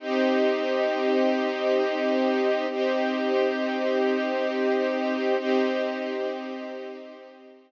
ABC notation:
X:1
M:3/4
L:1/8
Q:1/4=67
K:Cphr
V:1 name="String Ensemble 1"
[CEG]6 | [CEG]6 | [CEG]6 |]